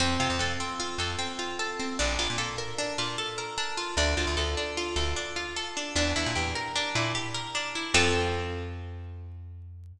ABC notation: X:1
M:5/4
L:1/16
Q:1/4=151
K:F
V:1 name="Pizzicato Strings"
C2 F2 A2 C2 F2 A2 C2 F2 A2 C2 | D2 F2 A2 B2 D2 F2 A2 B2 D2 F2 | D2 F2 A2 D2 F2 A2 D2 F2 A2 D2 | D2 E2 G2 B2 D2 E2 G2 B2 D2 E2 |
[CFA]20 |]
V:2 name="Electric Bass (finger)" clef=bass
F,,2 C, F,, F,,6 F,,10 | B,,,2 B,,, B,, B,,6 B,,10 | D,,2 D,, D,, D,,6 D,,10 | E,,2 E,, B,, E,,6 B,,10 |
F,,20 |]